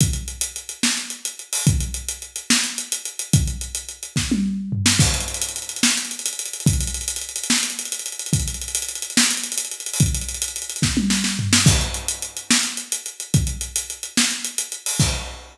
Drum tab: CC |------------------------|------------------------|------------------------|x-----------------------|
HH |x-x-x-x-x-x---x-x-x-x-o-|x-x-x-x-x-x---x-x-x-x-x-|x-x-x-x-x-x-------------|-xxxxxxxxxxx-xxxxxxxxxxx|
SD |------------o-----------|------------o-----------|------------o---------o-|------------o-----------|
T1 |------------------------|------------------------|--------------o---------|------------------------|
FT |------------------------|------------------------|--------------------o---|------------------------|
BD |o-----------------------|o-----------------------|o-----------o-----------|o-----------------------|

CC |------------------------|------------------------|------------------------|x-----------------------|
HH |xxxxxxxxxxxx-xxxxxxxxxxx|xxxxxxxxxxxx-xxxxxxxxxxo|xxxxxxxxxxxx------------|--x-x-x-x-x---x-x-x-x-x-|
SD |------------o-----------|------------o-----------|------------o---o-o---o-|------------o-----------|
T1 |------------------------|------------------------|--------------o---------|------------------------|
FT |------------------------|------------------------|--------------------o---|------------------------|
BD |o-----------------------|o-----------------------|o-----------o-----------|o-----------------------|

CC |------------------------|x-----------------------|
HH |x-x-x-x-x-x---x-x-x-x-o-|------------------------|
SD |------------o-----------|------------------------|
T1 |------------------------|------------------------|
FT |------------------------|------------------------|
BD |o-----------------------|o-----------------------|